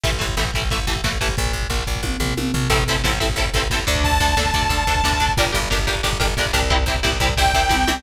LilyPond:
<<
  \new Staff \with { instrumentName = "Lead 2 (sawtooth)" } { \time 4/4 \key a \phrygian \tempo 4 = 180 r1 | r1 | r1 | a''1 |
r1 | r2 g''2 | }
  \new Staff \with { instrumentName = "Overdriven Guitar" } { \time 4/4 \key a \phrygian <e a>8 <e a>8 <e a>8 <e a>8 <e a>8 <e a>8 <e a>8 <e a>8 | r1 | <c' e' a'>8 <c' e' a'>8 <c' e' a'>8 <c' e' a'>8 <c' e' a'>8 <c' e' a'>8 <c' e' a'>8 <d' a'>8~ | <d' a'>8 <d' a'>8 <d' a'>8 <d' a'>8 <d' a'>8 <d' a'>8 <d' a'>8 <d' a'>8 |
<d' g' bes'>8 <d' g' bes'>8 <d' g' bes'>8 <d' g' bes'>8 <d' g' bes'>8 <d' g' bes'>8 <d' g' bes'>8 <d' g' bes'>8 | <c' e' g'>8 <c' e' g'>8 <c' e' g'>8 <c' e' g'>8 <c' e' g'>8 <c' e' g'>8 <c' e' g'>8 <c' e' g'>8 | }
  \new Staff \with { instrumentName = "Electric Bass (finger)" } { \clef bass \time 4/4 \key a \phrygian a,,8 a,,8 a,,8 a,,8 a,,8 a,,8 a,,8 a,,8 | bes,,8 bes,,8 bes,,8 bes,,8 bes,,8 bes,,8 bes,,8 bes,,8 | a,,8 a,,8 a,,8 a,,8 a,,8 a,,8 a,,8 d,8~ | d,8 d,8 d,8 d,8 d,8 d,8 d,8 d,8 |
g,,8 g,,8 g,,8 g,,8 g,,8 g,,8 g,,8 c,8~ | c,8 c,8 c,8 c,8 c,8 c,8 c,8 c,8 | }
  \new DrumStaff \with { instrumentName = "Drums" } \drummode { \time 4/4 <hh bd>16 bd16 <hh bd>16 bd16 <bd sn>16 bd16 <hh bd>16 bd16 <hh bd>16 bd16 <hh bd>16 bd16 <bd sn>16 bd16 <hh bd>16 bd16 | <hh bd>16 bd16 <hh bd>16 bd16 <bd sn>16 bd16 <hh bd>16 bd16 <bd tommh>8 tomfh8 tommh8 tomfh8 | <cymc bd>16 bd16 <bd cymr>16 bd16 <bd sn>16 bd16 <bd cymr>16 bd16 <bd cymr>16 bd16 <bd cymr>16 bd16 <bd sn>16 bd16 <bd cymr>16 bd16 | <bd cymr>16 bd16 <bd cymr>16 bd16 <bd sn>16 bd16 <bd cymr>16 bd16 <bd cymr>16 bd16 <bd cymr>16 bd16 <bd sn>16 bd16 <bd cymr>16 bd16 |
<bd cymr>16 bd16 <bd cymr>16 bd16 <bd sn>16 bd16 <bd cymr>16 bd16 <bd cymr>16 bd16 <bd cymr>16 bd16 <bd sn>16 bd16 <bd cymr>16 bd16 | <bd cymr>16 bd16 <bd cymr>16 bd16 <bd sn>16 bd16 <bd cymr>16 bd16 <bd cymr>16 bd16 <bd cymr>16 bd16 <bd tommh>8 tommh8 | }
>>